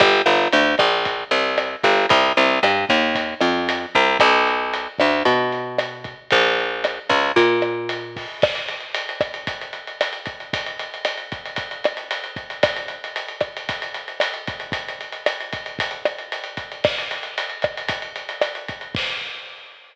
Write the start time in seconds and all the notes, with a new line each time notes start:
0.00 G1, kick, cross-stick, closed hi-hat
0.26 G1, closed hi-hat
0.52 D2, closed hi-hat
0.78 A#1, kick, cross-stick, closed hi-hat
1.05 kick, closed hi-hat
1.31 C2, closed hi-hat
1.58 cross-stick, closed hi-hat
1.83 G1, kick, closed hi-hat
2.09 C2, kick, closed hi-hat
2.37 C2, closed hi-hat
2.63 G2, cross-stick, closed hi-hat
2.89 D#2, kick, closed hi-hat
3.15 kick, closed hi-hat
3.41 F2, cross-stick, closed hi-hat
3.69 closed hi-hat
3.95 C2, kick, closed hi-hat
4.19 B1, kick, cross-stick, closed hi-hat
4.47 closed hi-hat
4.74 closed hi-hat
4.98 D2, kick, cross-stick, closed hi-hat
5.25 B2, kick, closed hi-hat
5.52 closed hi-hat
5.79 cross-stick, closed hi-hat
6.04 kick, closed hi-hat
6.30 A#1, kick, closed hi-hat
6.60 closed hi-hat
6.84 cross-stick, closed hi-hat
7.09 C#2, kick, closed hi-hat
7.36 A#2, kick, closed hi-hat
7.62 cross-stick, closed hi-hat
7.89 closed hi-hat
8.16 kick, open hi-hat
8.42 kick, cross-stick, crash
8.55 closed hi-hat
8.68 closed hi-hat
8.80 closed hi-hat
8.94 closed hi-hat
9.09 closed hi-hat
9.21 kick, cross-stick, closed hi-hat
9.34 closed hi-hat
9.47 kick, closed hi-hat
9.61 closed hi-hat
9.73 closed hi-hat
9.87 closed hi-hat
10.01 cross-stick, closed hi-hat
10.13 closed hi-hat
10.26 kick, closed hi-hat
10.40 closed hi-hat
10.53 kick, closed hi-hat
10.66 closed hi-hat
10.79 closed hi-hat
10.94 closed hi-hat
11.05 cross-stick, closed hi-hat
11.18 closed hi-hat
11.32 kick, closed hi-hat
11.46 closed hi-hat
11.56 kick, closed hi-hat
11.71 closed hi-hat
11.84 cross-stick, closed hi-hat
11.97 closed hi-hat
12.11 closed hi-hat
12.24 closed hi-hat
12.36 kick, closed hi-hat
12.50 closed hi-hat
12.63 kick, cross-stick, closed hi-hat
12.76 closed hi-hat
12.88 closed hi-hat
13.04 closed hi-hat
13.16 closed hi-hat
13.28 closed hi-hat
13.40 kick, cross-stick, closed hi-hat
13.57 closed hi-hat
13.69 kick, closed hi-hat
13.82 closed hi-hat
13.94 closed hi-hat
14.08 closed hi-hat
14.20 cross-stick, closed hi-hat
14.34 closed hi-hat
14.47 kick, closed hi-hat
14.60 closed hi-hat
14.72 kick, closed hi-hat
14.88 closed hi-hat
15.01 closed hi-hat
15.12 closed hi-hat
15.26 cross-stick, closed hi-hat
15.40 closed hi-hat
15.53 kick, closed hi-hat
15.66 closed hi-hat
15.79 kick, closed hi-hat
15.91 closed hi-hat
16.05 cross-stick, closed hi-hat
16.18 closed hi-hat
16.32 closed hi-hat
16.44 closed hi-hat
16.57 kick, closed hi-hat
16.72 closed hi-hat
16.84 kick, cross-stick, crash
16.98 closed hi-hat
17.11 closed hi-hat
17.23 closed hi-hat
17.38 closed hi-hat
17.50 closed hi-hat
17.62 kick, cross-stick, closed hi-hat
17.77 closed hi-hat
17.88 kick, closed hi-hat
18.02 closed hi-hat
18.16 closed hi-hat
18.29 closed hi-hat
18.41 cross-stick, closed hi-hat
18.55 closed hi-hat
18.68 kick, closed hi-hat
18.81 closed hi-hat
18.95 kick, crash